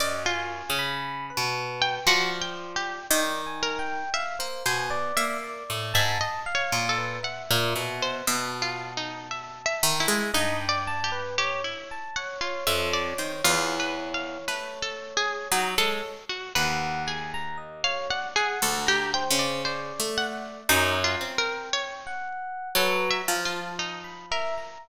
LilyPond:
<<
  \new Staff \with { instrumentName = "Orchestral Harp" } { \time 4/4 \tempo 4 = 58 \tuplet 3/2 { ges,4 des4 b,4 } f4 ees4 | r16 bes16 b,8 bes8 a,16 aes,16 r8 bes,8 r16 bes,16 b,8 | b,4. ees16 aes16 g,4. r8 | r16 f,8 ees16 e,4 a4 ges16 aes16 r8 |
ees,2 \tuplet 3/2 { d,4 des4 a4 } | ges,8 c'4. ges8 f4. | }
  \new Staff \with { instrumentName = "Harpsichord" } { \time 4/4 d''16 f'4 r8 g''16 \tuplet 3/2 { ges'8 g''8 g'8 } g''8 bes'8 | e''16 r16 c''8 e''8. e''16 \tuplet 3/2 { ees''8 des''8 a'8 } ges''8. c''16 | \tuplet 3/2 { e''8 f'8 ees'8 e''8 e''8 e'8 ees'8 d''8 g'8 } g'16 e'8 ges''16 | f'16 e''16 d''16 c''16 \tuplet 3/2 { f'8 b'8 f''8 b'8 a'8 aes'8 } ees'16 a'8 ges'16 |
b'8 aes'8. f''16 ges''16 aes'16 a'16 g'16 g''16 d''16 c''8 ges''8 | \tuplet 3/2 { ees'8 f'8 bes'8 } des''4 \tuplet 3/2 { a'8 e''8 f'8 } ees'8 bes'8 | }
  \new Staff \with { instrumentName = "Electric Piano 1" } { \time 4/4 ees''16 aes''8 b''8 b'8. d''4 \tuplet 3/2 { d''8 aes''8 g''8 } | f''16 c''16 aes''16 d''8 d''8 a''8 f''8 b'16 e''4 | a''2 ees''16 g''16 a''16 b'16 des''16 des''16 a''16 des''16 | des''1 |
ges''8 aes''16 bes''16 ees''16 des''16 d''16 ges''8 bes''16 c''8 d''4 | \tuplet 3/2 { bes''4 g''4 ges''4 b'8 bes''8 a''8 } r16 b''16 e''16 bes''16 | }
>>